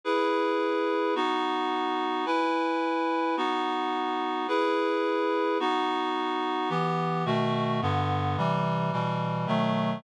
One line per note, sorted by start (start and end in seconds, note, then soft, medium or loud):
0.04 1.14 E4 medium
0.04 1.14 G#4 medium
0.04 1.14 B4 medium
1.15 2.25 B3 medium
1.15 2.25 D#4 loud
1.15 2.25 F#4 loud
2.26 3.36 E4 loud
2.26 3.36 B4 medium
2.26 3.36 G#5 medium
3.37 4.47 B3 loud
3.37 4.47 D#4 loud
3.37 4.47 F#4 loud
4.48 5.58 E4 medium
4.48 5.58 G#4 medium
4.48 5.58 B4 medium
5.60 6.69 B3 medium
5.60 6.70 D#4 loud
5.60 6.70 F#4 loud
6.69 7.24 E3 loud
6.69 7.24 B3 loud
6.69 7.24 G4 medium
7.25 7.80 B2 loud
7.25 7.80 D#3 loud
7.25 7.80 A3 loud
7.25 7.80 F#4 loud
7.82 8.37 G2 loud
7.82 8.37 D3 loud
7.82 8.37 B3 loud
8.37 8.92 C3 loud
8.37 8.92 E3 loud
8.37 8.92 G3 loud
8.92 9.46 B2 medium
8.92 9.47 E3 medium
8.92 9.47 G3 medium
9.47 10.02 B2 medium
9.47 10.02 D#3 loud
9.47 10.02 F#3 medium
9.47 10.02 A3 loud